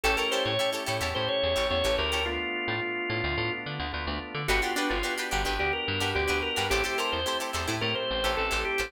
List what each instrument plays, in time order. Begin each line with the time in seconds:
0.03 electric bass (finger) A1, drawbar organ A3 C#4 E4 G4 A4, acoustic guitar (steel) E4 G4 A4 C#5
0.17 acoustic guitar (steel) E4 G4 A4 C#5, drawbar organ A#4
0.31 acoustic guitar (steel) E4 G4 A4 C#5, drawbar organ C5
0.45 electric bass (finger) A2, drawbar organ C#5
0.59 drawbar organ A3 C#4 E4 G4, acoustic guitar (steel) E4 G4 A4 C#5
0.72 acoustic guitar (steel) E4 G4 A4 C#5
0.86 electric bass (finger) A2, acoustic guitar (steel) E4 G4 A4 C#5
1.01 electric bass (finger) E2, acoustic guitar (steel) E4 G4 A4 C#5
1.15 electric bass (finger) A2, drawbar organ A3 C#4 E4 G4 C5
1.28 drawbar organ C#5
1.43 electric bass (finger) E2
1.56 electric bass (finger) A1, acoustic guitar (steel) E4 G4 A4 C#5
1.70 electric bass (finger) E2, drawbar organ A3 C#4 E4 G4 C#5
1.84 electric bass (finger) A1, acoustic guitar (steel) E4 G4 A4 C#5
1.98 electric bass (finger) D2, drawbar organ A#4
2.12 acoustic guitar (steel) E4 G4 A4 C#5
2.26 drawbar organ A3 B3 D4 F4
2.68 electric bass (finger) A2
2.81 drawbar organ A3 B3 D4 F4
3.10 electric bass (finger) A2
3.24 electric bass (finger) D2
3.37 electric bass (finger) A2, drawbar organ A3 B3 D4 F4
3.66 electric bass (finger) D3
3.80 electric bass (finger) D2
3.92 electric bass (finger) D2, drawbar organ A3 B3 D4 F4
4.07 electric bass (finger) D2
4.34 electric bass (finger) D3
4.48 electric bass (finger) G1, drawbar organ B3 D4 F#4 G4, acoustic guitar (steel) D4 F#4 G4 B4
4.62 acoustic guitar (steel) D4 F#4 G4 B4, drawbar organ F4
4.76 drawbar organ D4, acoustic guitar (steel) D4 F#4 G4 B4
4.90 electric bass (finger) G1, drawbar organ F4
5.03 drawbar organ B3 D4 F#4 G4, acoustic guitar (steel) D4 F#4 G4 B4
5.17 acoustic guitar (steel) D4 F#4 G4 B4
5.31 electric bass (finger) G1, acoustic guitar (steel) D4 F#4 G4 B4
5.45 electric bass (finger) G1, acoustic guitar (steel) D4 F#4 G4 B4
5.59 electric bass (finger) D2, drawbar organ B3 D4 F#4 G4
5.73 drawbar organ A#4
5.88 electric bass (finger) G2
6.00 electric bass (finger) G2, acoustic guitar (steel) D4 F#4 G4 B4
6.15 electric bass (finger) D2, drawbar organ B3 D4 F#4 G4
6.28 electric bass (finger) D2, acoustic guitar (steel) D4 F#4 G4 B4
6.42 drawbar organ A#4
6.56 electric bass (finger) G2, acoustic guitar (steel) D4 F#4 G4 B4
6.70 electric bass (finger) A1, drawbar organ A3 C4 E4 G4, acoustic guitar (steel) E4 G4 A4 C5
6.84 acoustic guitar (steel) E4 G4 A4 C5, drawbar organ G4
6.98 acoustic guitar (steel) E4 G4 A4 C5, drawbar organ A#4
7.12 electric bass (finger) E2, drawbar organ C5
7.26 drawbar organ A3 C4 E4 G4, acoustic guitar (steel) E4 G4 A4 C5
7.40 acoustic guitar (steel) E4 G4 A4 C5
7.53 electric bass (finger) E2, acoustic guitar (steel) E4 G4 A4 C5
7.67 electric bass (finger) A2, acoustic guitar (steel) E4 G4 A4 C5
7.81 electric bass (finger) A2, drawbar organ A3 C4 E4 G4 A#4
7.95 drawbar organ C5
8.11 electric bass (finger) A1
8.24 electric bass (finger) A1, acoustic guitar (steel) E4 G4 A4 C5
8.37 electric bass (finger) A1, drawbar organ A3 C4 E4 G4 A4
8.51 electric bass (finger) A1, acoustic guitar (steel) E4 G4 A4 C5
8.65 drawbar organ G4
8.78 electric bass (finger) A1, acoustic guitar (steel) E4 G4 A4 C5